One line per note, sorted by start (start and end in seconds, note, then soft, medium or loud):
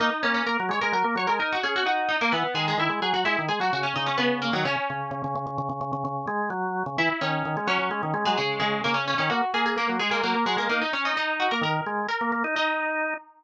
0.00 0.10 A#3 medium
0.00 0.22 D#4 medium
0.00 0.22 D#5 medium
0.23 0.43 A#3 medium
0.23 0.34 C#4 medium
0.23 0.34 C#5 medium
0.34 0.45 C#4 medium
0.34 0.45 C#5 medium
0.46 0.57 A#3 medium
0.46 0.67 A#4 medium
0.46 0.67 A#5 medium
0.60 0.71 F#3 medium
0.69 0.80 G#3 medium
0.69 0.82 C#5 medium
0.69 0.82 C#6 medium
0.81 0.94 G#3 medium
0.81 0.92 A#4 medium
0.81 0.92 A#5 medium
0.92 1.03 F#3 medium
0.92 1.15 A#4 medium
0.92 1.15 A#5 medium
1.04 1.15 A#3 medium
1.16 1.27 F#3 medium
1.16 1.28 C#5 medium
1.16 1.28 C#6 medium
1.27 1.39 G#3 medium
1.27 1.38 A#4 medium
1.27 1.38 A#5 medium
1.39 1.58 D#4 medium
1.39 1.51 A#4 medium
1.39 1.51 A#5 medium
1.53 1.64 F#4 medium
1.53 1.64 F#5 medium
1.63 1.83 C#4 medium
1.63 1.74 G#4 medium
1.63 1.74 G#5 medium
1.76 1.86 F#4 medium
1.76 1.86 F#5 medium
1.86 2.16 D#4 medium
1.86 2.09 F#4 medium
1.86 2.09 F#5 medium
2.09 2.20 D#4 medium
2.09 2.20 D#5 medium
2.21 2.32 A#3 medium
2.21 2.33 A#3 medium
2.21 2.32 A#4 medium
2.32 2.44 E3 medium
2.32 2.54 B3 medium
2.32 2.54 B4 medium
2.54 2.74 D#3 medium
2.54 2.66 G#3 medium
2.54 2.66 G#4 medium
2.68 2.79 G#3 medium
2.68 2.79 G#4 medium
2.78 2.89 D#3 medium
2.78 2.98 E4 medium
2.78 2.98 E5 medium
2.89 3.00 G#3 medium
3.02 3.13 F#3 medium
3.02 3.13 G#4 medium
3.02 3.13 G#5 medium
3.13 3.24 F#3 medium
3.13 3.25 F#4 medium
3.13 3.25 F#5 medium
3.25 3.37 G#3 medium
3.25 3.44 E4 medium
3.25 3.44 E5 medium
3.38 3.49 D#3 medium
3.48 3.59 G#3 medium
3.48 3.60 G#4 medium
3.48 3.60 G#5 medium
3.60 3.71 F#3 medium
3.60 3.72 F#4 medium
3.60 3.72 F#5 medium
3.73 3.94 C#3 medium
3.73 3.84 F#4 medium
3.73 3.84 F#5 medium
3.83 3.94 C#4 medium
3.83 3.94 C#5 medium
3.96 4.17 C#3 medium
3.96 4.07 D#4 medium
3.96 4.07 D#5 medium
4.06 4.17 C#4 medium
4.06 4.17 C#5 medium
4.18 4.51 C#3 medium
4.18 4.40 B3 medium
4.18 4.40 B4 medium
4.42 4.53 A#3 medium
4.42 4.53 A#4 medium
4.53 4.64 D#3 medium
4.53 4.64 F#3 medium
4.53 4.64 F#4 medium
4.65 4.76 C#3 medium
4.65 5.67 C#4 medium
4.65 5.67 C#5 medium
4.90 5.11 C#3 medium
5.11 5.22 C#3 medium
5.24 5.35 C#3 medium
5.35 5.46 C#3 medium
5.47 5.58 C#3 medium
5.58 5.69 C#3 medium
5.69 5.80 C#3 medium
5.81 5.92 C#3 medium
5.93 6.04 C#3 medium
6.05 6.26 C#3 medium
6.27 6.50 G#3 medium
6.50 6.83 F#3 medium
6.86 6.97 C#3 medium
6.98 7.09 E3 medium
6.98 7.20 E4 medium
6.98 7.20 E5 medium
7.21 7.43 D#3 medium
7.21 7.66 C#4 medium
7.21 7.66 C#5 medium
7.45 7.56 D#3 medium
7.57 7.68 G#3 medium
7.67 7.78 F#3 medium
7.67 8.22 C#4 medium
7.67 8.22 C#5 medium
7.79 7.90 F#3 medium
7.91 8.02 G#3 medium
8.03 8.14 D#3 medium
8.14 8.25 G#3 medium
8.25 8.37 F#3 medium
8.25 8.36 G#3 medium
8.25 8.36 G#4 medium
8.37 8.59 C#3 medium
8.37 8.59 G#3 medium
8.37 8.59 G#4 medium
8.60 8.81 C#3 medium
8.60 8.81 G#3 medium
8.60 8.81 G#4 medium
8.84 9.14 C#3 medium
8.84 8.95 A#3 medium
8.84 8.95 A#4 medium
8.94 9.05 C#4 medium
8.94 9.05 C#5 medium
9.08 9.18 C#4 medium
9.08 9.18 C#5 medium
9.18 9.30 D#3 medium
9.18 9.29 C#4 medium
9.18 9.29 C#5 medium
9.30 9.41 A#3 medium
9.30 9.51 F#4 medium
9.30 9.51 F#5 medium
9.54 9.76 A#3 medium
9.54 9.65 G#4 medium
9.54 9.65 G#5 medium
9.66 9.77 G#4 medium
9.66 9.77 G#5 medium
9.76 9.87 A#3 medium
9.76 9.96 A#3 medium
9.76 9.96 A#4 medium
9.89 10.00 F#3 medium
9.99 10.10 G#3 medium
9.99 10.10 G#4 medium
10.11 10.22 G#3 medium
10.11 10.22 A#3 medium
10.11 10.22 A#4 medium
10.23 10.35 F#3 medium
10.23 10.44 A#3 medium
10.23 10.44 A#4 medium
10.34 10.45 A#3 medium
10.46 10.57 F#3 medium
10.46 10.57 G#3 medium
10.46 10.57 G#4 medium
10.57 10.68 G#3 medium
10.57 10.69 A#3 medium
10.57 10.69 A#4 medium
10.69 10.81 A#3 medium
10.69 10.91 D#4 medium
10.69 10.81 A#4 medium
10.82 10.93 D#4 medium
10.82 10.93 D#5 medium
10.93 11.13 C#4 medium
10.93 11.04 C#4 medium
10.93 11.04 C#5 medium
11.05 11.16 D#4 medium
11.05 11.16 D#5 medium
11.16 11.49 D#4 medium
11.16 11.36 D#4 medium
11.16 11.36 D#5 medium
11.40 11.51 F#4 medium
11.40 11.51 F#5 medium
11.51 11.63 A#3 medium
11.51 11.62 A#4 medium
11.51 11.62 A#5 medium
11.61 11.81 D#3 medium
11.61 12.04 A#4 medium
11.61 12.04 A#5 medium
11.86 12.07 G#3 medium
12.09 12.53 A#4 soft
12.09 12.53 A#5 medium
12.21 12.32 A#3 medium
12.32 12.43 A#3 medium
12.44 12.55 D#4 medium
12.56 13.14 D#4 medium
12.56 13.44 D#4 medium
12.56 13.44 D#5 medium